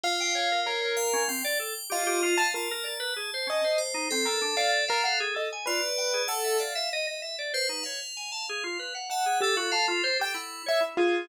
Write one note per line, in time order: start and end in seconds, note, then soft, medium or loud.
0.04 0.88 F4 loud
0.04 0.60 F5 loud
0.20 0.34 G5 medium
0.35 0.49 C#5 medium
0.52 0.66 A#4 medium
0.66 1.23 A#4 medium
0.66 0.81 C#5 medium
0.81 0.95 C#5 medium
0.97 1.25 F5 loud
1.13 1.27 C#4 loud
1.28 1.42 C4 medium
1.28 1.85 G5 medium
1.44 1.58 D5 loud
1.59 1.73 A4 medium
1.90 2.34 F4 loud
1.90 2.04 G4 medium
1.90 2.48 D#5 loud
2.07 2.21 G4 loud
2.23 2.37 F4 loud
2.38 2.53 F5 medium
2.38 2.52 A5 loud
2.54 2.68 F4 medium
2.54 3.10 A#4 soft
2.54 3.68 A5 medium
2.71 2.85 A#4 loud
2.83 2.98 D5 medium
3.00 3.14 B4 loud
3.16 3.30 G#4 medium
3.34 3.48 C5 medium
3.47 3.61 C#4 medium
3.47 3.78 D#5 loud
3.64 3.78 C5 medium
3.78 4.06 C5 medium
3.94 4.08 D#4 medium
4.11 4.26 C4 medium
4.11 5.23 A4 loud
4.25 4.40 A4 medium
4.25 4.39 A#4 medium
4.42 4.56 D4 medium
4.57 4.85 D5 loud
4.57 4.71 F5 loud
4.88 5.04 A#4 loud
4.88 5.02 F5 medium
5.04 5.19 F5 loud
5.04 5.18 F#5 medium
5.20 5.34 G#4 loud
5.35 5.49 A4 medium
5.35 5.50 D#5 medium
5.52 5.67 G#5 medium
5.66 5.81 F4 medium
5.66 6.22 B4 medium
5.66 6.23 D5 loud
5.98 6.12 G5 medium
6.14 6.28 G#4 medium
6.28 6.57 A4 loud
6.28 6.56 F#5 loud
6.44 6.58 E5 soft
6.58 6.73 D5 medium
6.58 7.43 E5 medium
6.58 6.89 F5 medium
6.75 6.89 E5 loud
6.93 7.06 D#5 loud
7.07 7.21 D#5 medium
7.22 7.36 E5 medium
7.39 7.53 D5 medium
7.54 7.82 B4 loud
7.54 7.68 C5 loud
7.69 7.83 D#4 medium
7.83 8.00 C#5 medium
7.83 8.96 F5 medium
8.17 8.31 G#5 medium
8.32 8.46 A5 medium
8.49 8.63 G#4 medium
8.64 8.78 F4 medium
8.79 8.93 B4 medium
8.95 9.09 F#5 medium
9.10 9.39 E5 medium
9.10 9.38 F#5 medium
9.10 9.24 A5 medium
9.26 9.40 G#4 medium
9.40 9.55 G4 medium
9.40 9.56 A4 loud
9.40 10.28 A4 medium
9.56 9.70 F4 medium
9.56 9.71 F#4 loud
9.71 9.86 F5 loud
9.71 9.87 A5 medium
9.88 10.02 F4 loud
10.04 10.18 C5 loud
10.19 10.33 G4 medium
10.19 10.35 G5 loud
10.34 10.62 E4 medium
10.34 10.62 F#5 medium
10.66 10.80 C#5 medium
10.66 10.83 E5 loud
10.80 10.95 E4 medium
10.97 11.25 F4 loud
10.97 11.26 G#4 medium